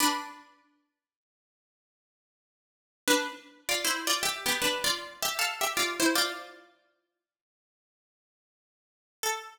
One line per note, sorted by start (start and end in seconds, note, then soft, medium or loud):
0.00 2.25 D4 loud
0.00 2.25 B4 loud
3.08 3.29 D4 loud
3.08 3.29 B4 loud
3.69 3.84 F4 medium
3.69 3.84 D5 loud
3.84 4.06 E4 medium
3.84 4.06 C5 loud
4.07 4.22 F4 medium
4.07 4.22 D5 loud
4.23 4.44 G4 medium
4.23 4.44 E5 loud
4.46 4.61 B3 medium
4.46 4.61 G4 loud
4.62 4.83 D4 medium
4.62 4.83 B4 loud
4.84 5.20 F4 medium
4.84 5.20 D5 loud
5.22 5.38 G4 medium
5.22 5.38 E5 loud
5.39 5.60 A4 loud
5.39 5.60 F5 loud
5.61 5.76 G4 medium
5.61 5.76 E5 loud
5.77 5.98 F4 medium
5.77 5.98 D5 loud
6.00 6.15 E4 medium
6.00 6.15 C5 loud
6.15 7.24 F4 loud
6.15 7.24 D5 loud
9.23 9.52 A4 loud